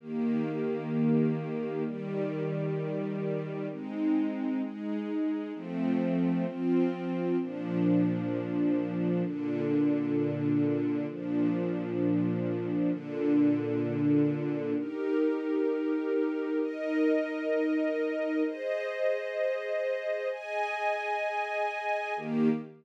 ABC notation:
X:1
M:4/4
L:1/8
Q:1/4=65
K:Eb
V:1 name="String Ensemble 1"
[E,B,G]4 [E,G,G]4 | [A,CE]2 [A,EA]2 [F,=A,C]2 [F,CF]2 | [B,,F,D]4 [B,,D,D]4 | [B,,F,D]4 [B,,D,D]4 |
[EGB]4 [EBe]4 | [Ace]4 [Aea]4 | [E,B,G]2 z6 |]